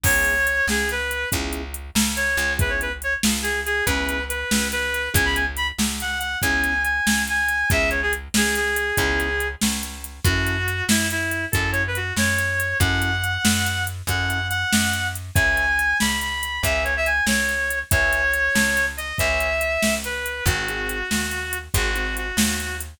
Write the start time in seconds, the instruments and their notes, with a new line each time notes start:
0.03 electric bass (finger) C#2, acoustic grand piano B3 C#4 E4 G#4, clarinet C#5, kick, crash
0.25 closed hi-hat
0.47 closed hi-hat
0.67 electric bass (finger) C#2, clarinet G#4, snare
0.89 clarinet B4, closed hi-hat
1.11 closed hi-hat
1.32 electric bass (finger) C#2, acoustic grand piano B3 C#4 E4 G#4, kick, closed hi-hat
1.53 closed hi-hat
1.74 closed hi-hat
1.95 electric bass (finger) C#2, snare
2.16 clarinet C#5, closed hi-hat
2.37 electric bass (finger) C#2, closed hi-hat
2.58 acoustic grand piano B3 C#4 E4 G#4, clarinet B4, kick, closed hi-hat
2.69 clarinet C#5
2.81 clarinet B4, closed hi-hat
3.02 clarinet C#5, closed hi-hat
3.23 electric bass (finger) C#2, snare
3.42 clarinet G#4, closed hi-hat
3.66 clarinet G#4, closed hi-hat
3.86 electric bass (finger) C#2, acoustic grand piano B3 C#4 E4 G#4, clarinet B4, kick, closed hi-hat
4.09 closed hi-hat
4.29 clarinet B4, closed hi-hat
4.51 electric bass (finger) C#2, snare
4.72 clarinet B4, closed hi-hat
4.94 closed hi-hat
5.14 electric bass (finger) C#2, acoustic grand piano B3 C#4 E4 G#4, clarinet G#5, kick, closed hi-hat
5.25 clarinet B5
5.35 clarinet G#5, closed hi-hat
5.57 clarinet B5, closed hi-hat
5.78 electric bass (finger) C#2, snare
6.00 clarinet F#5, closed hi-hat
6.19 clarinet F#5, closed hi-hat
6.42 electric bass (finger) C#2, acoustic grand piano B3 C#4 E4 G#4, clarinet G#5, kick, closed hi-hat
6.64 closed hi-hat
6.84 clarinet G#5, closed hi-hat
7.07 electric bass (finger) C#2, snare
7.27 clarinet G#5, closed hi-hat
7.48 closed hi-hat
7.70 electric bass (finger) C#2, acoustic grand piano B3 C#4 E4 G#4, clarinet E5, kick, closed hi-hat
7.90 clarinet C#5, closed hi-hat
8.02 clarinet G#4
8.13 closed hi-hat
8.34 electric bass (finger) C#2, clarinet G#4, snare
8.55 clarinet G#4, closed hi-hat
8.76 closed hi-hat
8.97 electric bass (finger) C#2, acoustic grand piano B3 C#4 E4 G#4, kick, closed hi-hat
9.20 closed hi-hat
9.40 closed hi-hat
9.61 electric bass (finger) C#2, snare
9.83 closed hi-hat
10.04 closed hi-hat
10.24 electric bass (finger) F#2, acoustic grand piano C#4 E4 F#4 A4, clarinet F#4, kick, closed hi-hat
10.47 closed hi-hat
10.68 closed hi-hat
10.89 electric bass (finger) F#2, clarinet E4, snare
11.10 clarinet E4, closed hi-hat
11.31 closed hi-hat
11.52 electric bass (finger) F#2, acoustic grand piano C#4 E4 F#4 A4, clarinet A4, kick, closed hi-hat
11.72 clarinet C#5, closed hi-hat
11.87 clarinet B4
11.95 clarinet F#4, closed hi-hat
12.16 electric bass (finger) F#2, clarinet C#5, snare
12.38 closed hi-hat
12.60 closed hi-hat
12.80 electric bass (finger) F#2, acoustic grand piano C#4 E4 F#4 A4, clarinet F#5, kick, closed hi-hat
13.02 closed hi-hat
13.24 closed hi-hat
13.45 electric bass (finger) F#2, snare
13.66 closed hi-hat
13.87 closed hi-hat
14.07 electric bass (finger) F#2, acoustic grand piano C#4 E4 F#4 A4, clarinet F#5, kick, closed hi-hat
14.30 closed hi-hat
14.50 clarinet F#5, closed hi-hat
14.73 electric bass (finger) F#2, snare
14.93 closed hi-hat
15.15 closed hi-hat
15.35 electric bass (finger) C#2, acoustic grand piano B4 C#5 E5 G#5, clarinet G#5, kick, closed hi-hat
15.57 closed hi-hat
15.79 closed hi-hat
16.00 electric bass (finger) C#2, clarinet B5, snare
16.21 clarinet B5, closed hi-hat
16.43 closed hi-hat
16.63 electric bass (finger) C#2, acoustic grand piano B4 C#5 E5 G#5, clarinet E5, kick, closed hi-hat
16.84 clarinet C#5, closed hi-hat
16.97 clarinet E5
17.06 clarinet G#5, closed hi-hat
17.26 electric bass (finger) C#2, clarinet C#5, snare
17.49 closed hi-hat
17.70 closed hi-hat
17.91 electric bass (finger) C#2, acoustic grand piano B4 C#5 E5 G#5, clarinet C#5, kick, closed hi-hat
18.13 closed hi-hat
18.34 closed hi-hat
18.55 electric bass (finger) C#2, snare
18.77 closed hi-hat
18.97 clarinet D#5, closed hi-hat
19.18 electric bass (finger) C#2, acoustic grand piano B4 C#5 E5 G#5, clarinet E5, kick, closed hi-hat
19.40 closed hi-hat
19.61 closed hi-hat
19.82 electric bass (finger) C#2, snare
20.04 clarinet B4, closed hi-hat
20.26 closed hi-hat
20.46 electric bass (finger) G#1, acoustic grand piano C4 D#4 F#4 G#4, clarinet F#4, kick, closed hi-hat
20.68 acoustic grand piano C4 D#4 F#4 G#4, closed hi-hat
20.89 closed hi-hat
21.11 electric bass (finger) D#2, snare
21.31 closed hi-hat
21.53 closed hi-hat
21.74 electric bass (finger) G#1, acoustic grand piano C4 D#4 F#4 G#4, clarinet F#4, kick, closed hi-hat
21.95 acoustic grand piano C4 D#4 F#4 G#4, closed hi-hat
22.17 clarinet F#4, closed hi-hat
22.37 electric bass (finger) D#2, snare
22.60 closed hi-hat
22.80 closed hi-hat